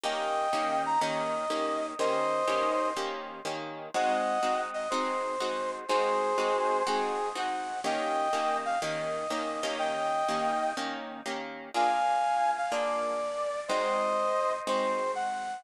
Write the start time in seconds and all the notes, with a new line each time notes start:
0.04 D#3 A#3 C#4 G4 D#5 G5
0.53 D#3 A#3 C#4 G4
0.86 A#5
1.01 D#3 A#3 C#4 G4 D#5
1.50 D#3 A#3 C#4 G4
1.99 D#3 A#3 C#4 G4 C5 D#5
2.48 D#3 A#3 C#4 G4
2.97 D#3 A#3 C#4 G4
3.45 D#3 A#3 C#4 G4
3.94 G#3 C4 D#4 F#4 D#5 F#5
4.43 G#3 C4 D#4 F#4
4.74 D#5
4.90 G#3 C4 D#4 F#4 C5
5.40 G#3 C4 D#4 F#4
5.89 G#3 C4 D#4 F#4 G#4 C5
6.38 G#3 C4 D#4 F#4
6.87 G#3 C4 D#4 F#4 G#4
7.35 G#3 C4 D#4 F#4 F#5
7.84 D#3 A#3 C#4 G4 D#5 G5
8.33 D#3 A#3 C#4 G4
8.65 F5
8.82 D#3 A#3 C#4 G4 D#5
9.30 D#3 A#3 C#4 G4
9.63 D#3 A#3 C#4 G4
9.79 D#5 G5
10.29 D#3 A#3 C#4 G4
10.77 D#3 A#3 C#4 G4
11.26 D#3 A#3 C#4 G4
11.74 A#3 D4 F4 G#4 F5 G#5
12.57 F5
12.71 A#3 D4 F4 G#4 D5
13.68 G#3 C4 D#4 F#4 C5 D#5
14.67 G#3 C4 D#4 F#4 C5
15.15 F#5